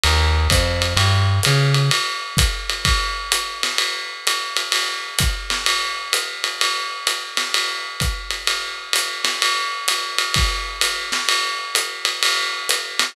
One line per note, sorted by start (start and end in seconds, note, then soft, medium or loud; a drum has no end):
0.04 0.48 D#2 medium
0.04 ride loud
0.50 0.94 F2 medium
0.50 kick medium
0.50 hi-hat pedal medium
0.50 ride medium
0.82 ride medium
0.96 1.40 G2 medium
0.96 ride loud
1.43 1.90 C#3 medium
1.43 hi-hat pedal medium
1.43 ride medium
1.74 ride medium
1.91 ride loud
2.37 kick medium
2.37 hi-hat pedal medium
2.37 ride medium
2.70 ride medium
2.85 kick medium
2.85 ride loud
3.32 hi-hat pedal medium
3.32 ride medium
3.63 snare medium
3.63 ride medium
3.78 ride medium
4.27 hi-hat pedal medium
4.27 ride medium
4.57 ride medium
4.72 ride loud
5.19 kick medium
5.19 hi-hat pedal medium
5.19 ride medium
5.50 snare medium
5.50 ride medium
5.66 ride loud
6.13 hi-hat pedal medium
6.13 ride medium
6.44 ride medium
6.61 ride loud
7.07 hi-hat pedal medium
7.07 ride medium
7.37 snare medium
7.37 ride medium
7.54 ride loud
8.00 kick medium
8.00 hi-hat pedal medium
8.00 ride medium
8.30 ride medium
8.47 ride medium
8.93 hi-hat pedal medium
8.93 ride medium
9.25 snare medium
9.25 ride medium
9.42 ride loud
9.88 hi-hat pedal medium
9.88 ride medium
10.18 ride medium
10.34 kick medium
10.34 ride loud
10.81 hi-hat pedal medium
10.81 ride loud
11.12 snare medium
11.12 ride medium
11.29 ride loud
11.75 hi-hat pedal medium
11.75 ride medium
12.05 ride medium
12.23 ride loud
12.69 hi-hat pedal medium
12.69 ride medium
12.99 snare medium
12.99 ride medium